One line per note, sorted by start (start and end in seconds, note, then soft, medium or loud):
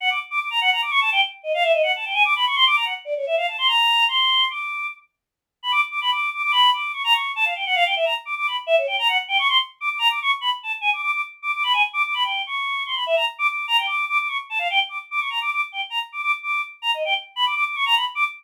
0.00 0.10 F#5 loud
0.10 0.19 D6 medium
0.31 0.40 D6 medium
0.40 0.49 D6 medium
0.50 0.60 A#5 medium
0.61 0.70 F#5 loud
0.72 0.81 A#5 medium
0.82 0.91 D6 medium
0.91 1.00 C#6 loud
1.01 1.10 A5 loud
1.12 1.21 G5 loud
1.43 1.52 D#5 medium
1.54 1.63 F5 loud
1.63 1.72 E5 loud
1.73 1.82 D#5 medium
1.83 1.92 F#5 medium
1.96 2.05 A5 medium
2.05 2.14 G5 medium
2.14 2.23 G#5 loud
2.25 2.34 D6 loud
2.36 2.45 B5 medium
2.47 2.56 C#6 medium
2.56 2.65 C6 loud
2.67 2.76 D6 loud
2.76 2.85 A#5 medium
2.85 2.94 F#5 medium
3.05 3.14 D5 medium
3.17 3.26 C#5 medium
3.27 3.36 E5 medium
3.37 3.46 F5 medium
3.48 3.57 A5 medium
3.58 3.68 C6 loud
3.67 4.04 A#5 medium
4.08 4.45 C6 medium
4.50 4.87 D6 medium
5.63 5.72 B5 medium
5.72 5.81 D6 loud
5.91 6.00 D6 medium
6.01 6.11 B5 medium
6.11 6.30 D6 medium
6.34 6.42 D6 medium
6.43 6.52 D6 loud
6.52 6.70 B5 loud
6.73 6.92 D6 medium
6.93 7.03 C#6 medium
7.04 7.13 A#5 loud
7.13 7.32 C#6 medium
7.36 7.45 A5 loud
7.45 7.54 F5 medium
7.55 7.65 G5 medium
7.66 7.75 F#5 loud
7.75 7.84 F5 loud
7.85 7.95 G5 medium
7.96 8.05 E5 medium
8.05 8.14 A#5 medium
8.25 8.35 D6 medium
8.37 8.47 D6 medium
8.47 8.56 B5 medium
8.67 8.76 E5 loud
8.78 8.87 C#5 medium
8.87 8.96 G5 medium
8.99 9.08 A#5 medium
9.08 9.18 F#5 loud
9.28 9.37 G5 loud
9.39 9.48 C#6 loud
9.48 9.58 C6 loud
9.81 9.89 D6 medium
9.90 9.99 D6 medium
9.99 10.08 A#5 loud
10.10 10.19 D6 medium
10.22 10.31 C#6 loud
10.41 10.50 B5 medium
10.63 10.72 A5 medium
10.81 10.90 G#5 loud
10.93 11.01 D6 medium
11.02 11.11 D6 medium
11.12 11.21 D6 medium
11.42 11.52 D6 medium
11.54 11.63 D6 medium
11.64 11.73 B5 loud
11.73 11.82 G#5 loud
11.93 12.02 D6 loud
12.05 12.14 D6 medium
12.14 12.23 B5 medium
12.23 12.42 G5 medium
12.47 12.83 C#6 medium
12.86 12.95 C6 medium
12.95 13.04 B5 medium
13.06 13.16 E5 loud
13.16 13.25 A#5 medium
13.39 13.47 D6 loud
13.48 13.66 D6 medium
13.68 13.77 A#5 loud
13.78 13.87 G5 medium
13.87 14.05 D6 medium
14.09 14.18 D6 loud
14.19 14.28 D6 medium
14.28 14.37 C#6 medium
14.50 14.59 A5 medium
14.59 14.68 F5 medium
14.70 14.79 G5 loud
14.89 14.98 D6 medium
15.11 15.20 D6 medium
15.20 15.29 C#6 medium
15.30 15.39 A#5 medium
15.41 15.50 D6 medium
15.52 15.61 D6 medium
15.72 15.81 G5 medium
15.90 15.99 A#5 medium
16.12 16.22 D6 medium
16.23 16.32 D6 loud
16.43 16.61 D6 medium
16.82 16.91 A#5 medium
16.94 17.03 D#5 medium
17.05 17.14 G5 medium
17.36 17.45 B5 loud
17.46 17.55 D6 medium
17.55 17.64 D6 loud
17.66 17.76 D6 soft
17.76 17.85 C#6 medium
17.86 17.95 A#5 loud
17.96 18.05 B5 medium
18.15 18.24 D6 loud